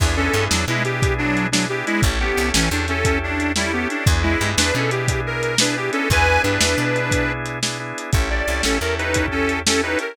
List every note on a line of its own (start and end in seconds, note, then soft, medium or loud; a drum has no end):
0.00 0.29 E2 medium
0.00 0.16 B3 medium
0.00 0.16 D4 loud
0.00 0.16 E4 medium
0.00 0.16 G#4 medium
0.00 kick loud
0.00 crash medium
0.17 0.32 B3 medium
0.17 0.45 C#4 medium
0.17 0.32 D4 medium
0.17 0.32 E4 medium
0.17 0.32 G#4 medium
0.17 0.45 A4 medium
0.33 0.48 G2 medium
0.33 0.65 B3 medium
0.33 0.65 D4 medium
0.33 0.65 E4 medium
0.33 0.65 G#4 medium
0.33 closed hi-hat medium
0.51 0.66 E2 medium
0.51 0.65 F#3 medium
0.51 0.65 D4 medium
0.51 snare medium
0.68 1.83 B2 medium
0.68 0.83 G#3 medium
0.68 0.83 B3 medium
0.68 0.83 D4 medium
0.68 0.83 E4 medium
0.68 0.83 G#4 medium
0.85 1.01 B3 medium
0.85 1.01 D4 medium
0.85 1.01 E4 medium
0.85 1.14 G4 medium
0.85 1.01 G#4 medium
0.85 closed hi-hat medium
1.02 1.49 B3 medium
1.02 1.49 D4 medium
1.02 1.49 E4 medium
1.02 1.49 G#4 medium
1.02 kick medium
1.02 closed hi-hat medium
1.18 1.47 F#3 medium
1.18 1.47 D4 medium
1.37 closed hi-hat medium
1.52 1.66 F#3 medium
1.52 1.68 B3 medium
1.52 1.66 D4 medium
1.52 1.68 D4 medium
1.52 1.68 E4 medium
1.52 1.68 G#4 medium
1.52 snare loud
1.69 2.01 B3 medium
1.69 2.01 D4 medium
1.69 2.01 E4 medium
1.69 1.85 G4 medium
1.69 2.01 G#4 medium
1.86 2.01 G#3 medium
1.86 2.01 E4 medium
1.86 closed hi-hat medium
2.02 2.32 A1 medium
2.02 2.19 C#4 loud
2.02 2.19 E4 medium
2.02 2.19 G4 medium
2.02 2.19 A4 medium
2.02 kick loud
2.02 closed hi-hat medium
2.20 2.50 B3 medium
2.20 2.36 C#4 medium
2.20 2.36 E4 medium
2.20 2.50 G4 medium
2.20 2.36 G4 medium
2.20 2.36 A4 medium
2.37 2.52 C2 medium
2.37 2.69 C#4 medium
2.37 2.69 E4 medium
2.37 2.69 G4 medium
2.37 2.69 A4 medium
2.37 closed hi-hat medium
2.54 2.69 A1 medium
2.54 2.69 E3 medium
2.54 2.69 C#4 medium
2.54 snare loud
2.71 3.87 E2 medium
2.71 2.87 C#4 medium
2.71 2.86 D4 medium
2.71 2.87 E4 medium
2.71 2.87 G4 medium
2.71 2.87 A4 medium
2.88 3.04 C#4 medium
2.88 3.19 C#4 medium
2.88 3.04 E4 medium
2.88 3.04 G4 medium
2.88 3.04 A4 medium
2.88 3.19 A4 medium
2.88 closed hi-hat medium
3.05 3.52 C#4 medium
3.05 3.52 E4 medium
3.05 3.52 G4 medium
3.05 3.52 A4 medium
3.05 kick medium
3.05 closed hi-hat medium
3.23 3.52 D4 medium
3.40 closed hi-hat medium
3.56 3.73 G3 medium
3.56 3.71 C#4 medium
3.56 3.71 E4 medium
3.56 3.73 E4 medium
3.56 3.71 G4 medium
3.56 3.71 A4 medium
3.56 snare medium
3.73 3.88 B3 medium
3.73 4.04 C#4 medium
3.73 4.04 E4 medium
3.73 3.88 G4 medium
3.73 4.04 G4 medium
3.73 4.04 A4 medium
3.90 4.06 D4 medium
3.90 closed hi-hat medium
4.06 4.36 E2 loud
4.06 4.23 B3 medium
4.06 4.23 D4 medium
4.06 4.23 E4 medium
4.06 4.23 G#4 loud
4.06 kick loud
4.06 closed hi-hat medium
4.23 4.51 G#3 medium
4.23 4.39 B3 medium
4.23 4.39 D4 medium
4.23 4.51 E4 medium
4.23 4.39 E4 medium
4.23 4.39 G#4 medium
4.41 4.55 G2 medium
4.41 4.72 B3 medium
4.41 4.72 D4 medium
4.41 4.72 E4 medium
4.41 4.72 G#4 medium
4.41 closed hi-hat medium
4.58 4.72 E2 medium
4.58 4.74 D4 medium
4.58 4.74 B4 medium
4.58 snare loud
4.74 5.90 B2 medium
4.74 4.89 B3 medium
4.74 4.91 C#4 medium
4.74 4.89 D4 medium
4.74 4.89 E4 medium
4.74 4.89 G#4 medium
4.74 4.91 A4 medium
4.91 5.07 B3 medium
4.91 5.07 D4 medium
4.91 5.07 E4 medium
4.91 5.21 G4 medium
4.91 5.07 G#4 medium
4.91 closed hi-hat medium
5.08 5.55 B3 medium
5.08 5.55 D4 medium
5.08 5.55 E4 medium
5.08 5.55 G#4 medium
5.08 kick medium
5.08 closed hi-hat loud
5.27 5.58 A#4 medium
5.43 closed hi-hat medium
5.58 5.75 B3 medium
5.58 5.75 D4 medium
5.58 5.77 D4 medium
5.58 5.75 E4 medium
5.58 5.75 G#4 medium
5.58 5.77 B4 medium
5.58 snare loud
5.77 6.08 B3 medium
5.77 6.08 D4 medium
5.77 6.08 E4 medium
5.77 5.91 G4 medium
5.77 6.08 G#4 medium
5.93 6.09 C#4 medium
5.93 6.09 A4 medium
5.93 closed hi-hat medium
6.10 6.39 E2 medium
6.10 6.26 B3 medium
6.10 6.26 D4 medium
6.10 6.26 E4 loud
6.10 6.26 G#4 medium
6.10 6.42 B4 medium
6.10 6.42 G#5 medium
6.10 kick medium
6.10 closed hi-hat medium
6.28 6.43 B3 medium
6.28 6.43 D4 medium
6.28 6.43 E4 medium
6.28 6.43 G#4 medium
6.43 6.59 G2 medium
6.43 6.75 B3 medium
6.43 7.32 D4 medium
6.43 6.75 D4 medium
6.43 6.75 E4 medium
6.43 6.75 G#4 medium
6.43 7.32 B4 medium
6.43 closed hi-hat medium
6.61 6.75 E2 medium
6.61 snare loud
6.77 7.93 B2 medium
6.77 6.93 B3 medium
6.77 6.93 D4 medium
6.77 6.93 E4 medium
6.77 6.93 G#4 medium
6.95 7.11 B3 medium
6.95 7.11 D4 medium
6.95 7.11 E4 medium
6.95 7.11 G#4 medium
6.95 closed hi-hat medium
7.11 7.59 B3 medium
7.11 7.59 D4 medium
7.11 7.59 E4 medium
7.11 7.59 G#4 medium
7.11 kick medium
7.11 closed hi-hat loud
7.46 closed hi-hat medium
7.62 7.78 B3 medium
7.62 7.78 D4 medium
7.62 7.78 E4 medium
7.62 7.78 G#4 medium
7.62 snare medium
7.80 8.11 B3 medium
7.80 8.11 D4 medium
7.80 8.11 E4 medium
7.80 8.11 G#4 medium
7.98 closed hi-hat medium
8.13 8.43 A1 medium
8.13 8.29 C#4 loud
8.13 8.29 E4 medium
8.13 8.29 G4 medium
8.13 8.29 A4 medium
8.13 kick loud
8.13 closed hi-hat medium
8.30 8.46 C#4 medium
8.30 8.46 E4 medium
8.30 8.46 G4 medium
8.30 8.46 A4 medium
8.30 8.62 D5 medium
8.48 8.62 C2 medium
8.48 8.79 C#4 medium
8.48 8.79 E4 medium
8.48 8.79 G4 medium
8.48 8.79 A4 medium
8.48 closed hi-hat medium
8.63 8.79 A1 medium
8.63 8.78 C#4 medium
8.63 8.78 A4 medium
8.63 snare medium
8.81 9.96 E2 medium
8.81 8.98 C#4 medium
8.81 8.98 E4 medium
8.81 8.98 G4 medium
8.81 8.98 A4 medium
8.81 8.95 A#4 medium
8.98 9.14 C#4 medium
8.98 9.26 D#4 medium
8.98 9.14 E4 medium
8.98 9.14 G4 medium
8.98 9.14 A4 medium
8.98 9.26 B4 medium
8.98 closed hi-hat medium
9.14 9.62 C#4 loud
9.14 9.62 E4 medium
9.14 9.62 G4 medium
9.14 9.62 A4 medium
9.14 kick medium
9.14 closed hi-hat loud
9.28 9.59 C#4 medium
9.28 9.59 A4 medium
9.28 kick medium
9.49 closed hi-hat medium
9.66 9.82 C#4 medium
9.66 9.82 E4 medium
9.66 9.82 G4 medium
9.66 9.82 A4 medium
9.66 snare loud
9.83 10.14 C#4 medium
9.83 9.98 D#4 medium
9.83 10.14 E4 medium
9.83 10.14 G4 medium
9.83 10.14 A4 medium
9.83 9.98 B4 medium
9.99 10.16 A#4 medium
9.99 closed hi-hat medium